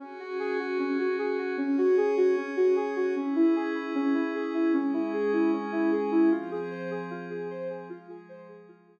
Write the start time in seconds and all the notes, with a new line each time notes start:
0.00 C#4 F#4 G#4
0.19 F#4
0.39 G#4
0.59 F#4
0.79 C#4
0.99 F#4
1.19 G#4
1.38 F#4
1.58 C#4 G#4 C#5
1.78 F#4
1.97 G#4
2.17 F#4
2.37 C#4
2.57 F#4
2.76 G#4
2.96 F#4
3.15 C#4 E4 G#4
3.36 E4
3.56 G#4
3.75 E4
3.95 C#4
4.14 E4
4.35 G#4
4.54 E4
4.73 G#3 C#4 G#4
4.93 E4
5.13 G#4
5.33 E4
5.53 C#4
5.72 E4
5.92 G#4
6.12 E4
6.31 F3 C4 F4 G#4
6.51 G#4
6.71 C5
6.91 G#4
7.11 F4
7.30 G#4
7.50 C5
7.70 G#4
7.89 F3 G#3 F4 G#4
8.09 G#4
8.29 C5
8.49 G#4
8.68 F4
8.88 G#4